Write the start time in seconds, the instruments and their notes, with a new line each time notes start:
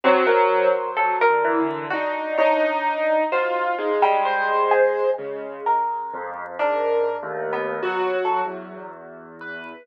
0.04 acoustic grand piano F#3 C5, orchestral harp C4
0.27 orchestral harp A#4
0.97 acoustic grand piano F#3, orchestral harp A4
1.21 orchestral harp A#4
1.29 acoustic grand piano D3
1.45 acoustic grand piano E3
1.60 acoustic grand piano D3
1.90 acoustic grand piano D4 D#4, orchestral harp F#4
2.38 acoustic grand piano D#4, orchestral harp C#5
3.32 acoustic grand piano F4 F#4, orchestral harp C5
3.78 acoustic grand piano G#3 D#4
4.02 orchestral harp G3
4.25 acoustic grand piano C5
4.71 orchestral harp G#4
5.18 acoustic grand piano C#3 G#3
5.66 orchestral harp A#4
6.13 acoustic grand piano F2
6.59 acoustic grand piano G#2 A#4, orchestral harp D4
7.23 acoustic grand piano D#2 A3
7.53 orchestral harp B3
7.83 acoustic grand piano F#3 F#4
8.25 orchestral harp A4
8.45 acoustic grand piano E2 F#3
9.41 acoustic grand piano B4